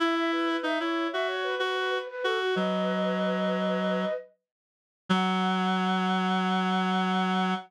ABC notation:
X:1
M:4/4
L:1/16
Q:1/4=94
K:F#dor
V:1 name="Flute"
e e B B e c2 e c B B B B B A F | [Bd]12 z4 | f16 |]
V:2 name="Clarinet"
E4 D E2 F3 F3 z F2 | F,10 z6 | F,16 |]